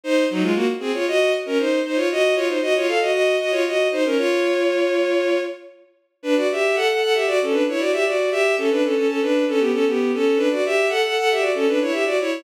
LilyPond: \new Staff { \time 4/4 \key bes \minor \tempo 4 = 116 <ees' c''>8 <ges ees'>16 <aes f'>16 <bes ges'>16 r16 <c' aes'>16 <f' des''>16 <ges' ees''>8 r16 <des' bes'>16 <ees' c''>8 <ees' c''>16 <f' des''>16 | <ges' ees''>8 <f' des''>16 <ees' c''>16 <ges' ees''>16 <f' des''>16 <a' f''>16 <ges' ees''>16 <ges' ees''>8 <ges' ees''>16 <f' des''>16 <ges' ees''>8 <ees' c''>16 <des' bes'>16 | <f' des''>2~ <f' des''>8 r4. | \key b \minor <d' b'>16 <fis' d''>16 <g' e''>8 <a' fis''>16 <a' fis''>16 <a' fis''>16 <g' e''>16 <fis' d''>16 <cis' a'>16 <d' b'>16 <e' cis''>16 <fis' d''>16 <g' e''>16 <fis' d''>8 |
<g' e''>8 <cis' a'>16 <d' b'>16 <cis' a'>16 <cis' a'>16 <cis' a'>16 <d' b'>8 <cis' a'>16 <b g'>16 <cis' a'>16 <b g'>8 <cis' a'>8 | <d' b'>16 <fis' d''>16 <g' e''>8 <a' fis''>16 <a' fis''>16 <a' fis''>16 <g' e''>16 <fis' d''>16 <cis' a'>16 <d' b'>16 <e' cis''>16 <g' e''>16 <fis' d''>16 <e' cis''>8 | }